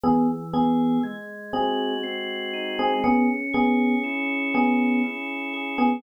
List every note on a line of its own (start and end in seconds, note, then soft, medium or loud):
0.04 0.99 E3 medium
0.04 0.27 B3 loud
0.04 0.27 G#4 loud
0.54 0.99 B3 medium
0.54 0.99 G#4 loud
0.54 1.01 G#4 medium
1.03 2.93 G#3 medium
1.53 1.94 C4 medium
1.53 2.96 F#4 medium
1.53 1.94 G#4 loud
2.03 2.98 C4 medium
2.53 3.01 D#4 medium
2.79 3.03 C4 loud
2.79 3.03 G#4 loud
3.04 3.28 B3 loud
3.04 5.03 C#4 loud
3.04 3.28 G#4 loud
3.53 3.95 B3 loud
3.53 4.53 G#4 medium
3.53 3.95 G#4 loud
4.04 5.94 E4 medium
4.54 5.01 B3 medium
4.54 5.53 G#4 medium
4.54 5.01 G#4 loud
5.04 5.99 C#4 medium
5.54 6.01 G#4 medium
5.78 6.02 B3 loud
5.78 6.02 G#4 loud